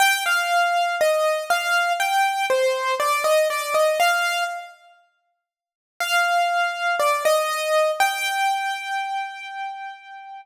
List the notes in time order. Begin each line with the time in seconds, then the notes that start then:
0.00 G5
0.26 F5
1.01 D#5
1.50 F5
2.00 G5
2.50 C5
3.00 D5
3.24 D#5
3.50 D5
3.74 D#5
4.00 F5
6.00 F5
7.00 D5
7.25 D#5
8.00 G5